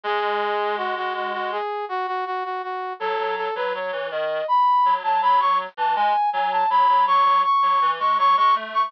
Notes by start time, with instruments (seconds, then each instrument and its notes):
0.04 clarinet G#3, brass section G#4
0.77 brass section F#4
0.96 brass section F#4
1.15 brass section F#4
1.33 brass section F#4
1.52 brass section G#4
1.89 brass section F#4
2.07 brass section F#4
2.26 brass section F#4
2.44 brass section F#4
2.63 brass section F#4
3.00 clarinet F#3, brass section A4
3.18 clarinet F#3
3.37 brass section A4
3.55 clarinet F#3, brass section B4
3.74 clarinet F#3, brass section C#5
3.92 clarinet E3
4.11 clarinet D#3, brass section D#5
4.48 brass section B5
4.85 clarinet F#3
5.04 clarinet F#3, brass section A5
5.22 clarinet F#3, brass section B5
5.40 brass section C#6
5.77 clarinet E3, brass section A5
5.96 clarinet G#3, brass section G#5
6.33 clarinet F#3, brass section G#5
6.52 brass section A5
6.70 clarinet F#3, brass section B5
6.89 clarinet F#3
7.07 clarinet F#3, brass section C#6
7.26 clarinet F#3
7.44 brass section C#6
7.63 clarinet F#3
7.82 clarinet E3
8.00 clarinet G#3, brass section C#6
8.18 clarinet F#3, brass section C#6
8.37 clarinet G#3, brass section C#6
8.56 clarinet A3
8.74 brass section C#6